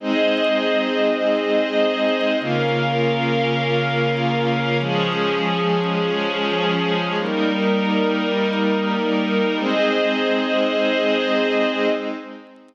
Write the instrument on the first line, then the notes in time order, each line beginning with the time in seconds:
pad 5 (bowed)
0.00 G#3 C4 D#4 G#4 C5 D#5
2.40 C#3 A#3 C#4 F4 A#4 F5
4.80 F3 G#3 C#4 G#4
7.20 G3 A#3 D#4 A#4
9.60 G#3 C4 D#4 G#4 C5 D#5